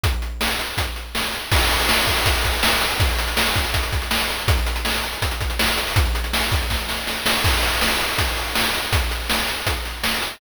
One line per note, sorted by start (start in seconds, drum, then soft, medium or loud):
0.04 kick loud
0.04 closed hi-hat loud
0.22 closed hi-hat medium
0.41 snare loud
0.59 closed hi-hat medium
0.77 kick loud
0.77 closed hi-hat loud
0.96 closed hi-hat medium
1.15 snare loud
1.33 closed hi-hat medium
1.52 kick loud
1.52 crash loud
1.61 closed hi-hat medium
1.70 closed hi-hat medium
1.80 closed hi-hat medium
1.89 snare loud
1.98 closed hi-hat medium
2.07 kick loud
2.07 closed hi-hat medium
2.17 closed hi-hat medium
2.26 kick loud
2.26 closed hi-hat loud
2.35 closed hi-hat medium
2.44 kick medium
2.44 closed hi-hat loud
2.53 closed hi-hat medium
2.63 snare loud
2.72 closed hi-hat medium
2.81 closed hi-hat loud
2.91 closed hi-hat medium
3.00 kick loud
3.00 closed hi-hat loud
3.09 closed hi-hat medium
3.19 closed hi-hat loud
3.28 closed hi-hat medium
3.37 snare loud
3.46 closed hi-hat medium
3.56 kick loud
3.56 closed hi-hat loud
3.65 closed hi-hat medium
3.74 kick loud
3.74 closed hi-hat loud
3.83 closed hi-hat medium
3.92 kick loud
3.92 closed hi-hat medium
4.02 closed hi-hat medium
4.11 snare loud
4.20 closed hi-hat medium
4.30 closed hi-hat medium
4.39 closed hi-hat medium
4.48 kick loud
4.48 closed hi-hat loud
4.57 closed hi-hat medium
4.67 closed hi-hat loud
4.76 closed hi-hat medium
4.85 snare loud
4.94 closed hi-hat loud
5.04 closed hi-hat medium
5.13 closed hi-hat medium
5.22 kick loud
5.22 closed hi-hat loud
5.31 closed hi-hat medium
5.41 kick loud
5.41 closed hi-hat medium
5.50 closed hi-hat medium
5.59 snare loud
5.68 closed hi-hat medium
5.78 closed hi-hat loud
5.87 open hi-hat medium
5.96 kick loud
5.96 closed hi-hat loud
6.06 closed hi-hat medium
6.15 closed hi-hat medium
6.24 closed hi-hat medium
6.33 snare loud
6.43 closed hi-hat medium
6.52 kick loud
6.52 closed hi-hat loud
6.61 closed hi-hat medium
6.70 kick medium
6.70 snare loud
6.89 snare loud
7.07 snare loud
7.26 snare loud
7.44 kick loud
7.44 crash loud
7.63 closed hi-hat medium
7.81 snare loud
8.00 closed hi-hat medium
8.18 kick loud
8.18 closed hi-hat loud
8.37 closed hi-hat medium
8.55 snare loud
8.74 closed hi-hat medium
8.93 kick loud
8.93 closed hi-hat loud
9.11 closed hi-hat medium
9.30 snare loud
9.48 closed hi-hat medium
9.67 kick loud
9.67 closed hi-hat loud
9.85 closed hi-hat medium
10.04 snare loud
10.22 closed hi-hat medium